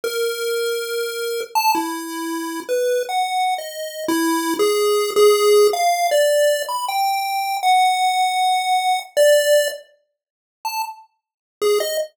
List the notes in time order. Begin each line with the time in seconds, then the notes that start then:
0.04 A#4
1.55 A5
1.75 E4
2.69 B4
3.09 F#5
3.58 D#5
4.08 E4
4.59 G#4
5.16 G#4
5.73 F5
6.11 D5
6.69 B5
6.88 G5
7.63 F#5
9.17 D5
10.65 A5
11.62 G#4
11.80 D#5